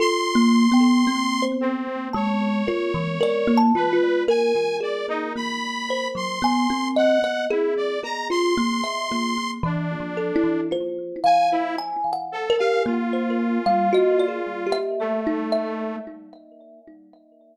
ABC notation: X:1
M:5/4
L:1/16
Q:1/4=56
K:none
V:1 name="Kalimba"
(3A2 ^A,2 B,2 C4 ^G,2 F E, d A, F2 ^A4 | ^A,3 ^F, B, C2 ^d ^G2 G =F A, e A,2 (3E,2 =F,2 E2 | c2 f2 (3^g2 ^f2 ^A2 ^A,3 =G, ^d =d2 e2 ^D3 |]
V:2 name="Lead 2 (sawtooth)"
c'6 C2 ^c6 B2 ^g2 d ^D | b3 c'3 ^f2 E d ^a c'5 D4 | z2 ^g E z2 A f F8 A,4 |]
V:3 name="Kalimba"
(3F4 g4 c4 a2 ^A2 (3A2 =a2 F2 z2 ^G2 | z2 c2 ^g2 ^d z3 ^G4 z4 A2 | F2 f2 ^g z2 =G z c z f (3^F2 ^G2 =G2 z2 e2 |]